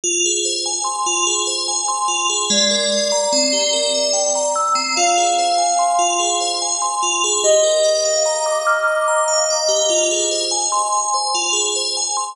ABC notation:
X:1
M:3/4
L:1/16
Q:1/4=73
K:Gphr
V:1 name="Ocarina"
z12 | d12 | f6 z6 | e12 |
z12 |]
V:2 name="Tubular Bells"
F A c a c' F A c a c' F A | A, B e b C G B =e g b =e' C | F A c a c' F A c a c' F A | G B d f b d' f' d' b f d G |
F A c a c' a c F A c a c' |]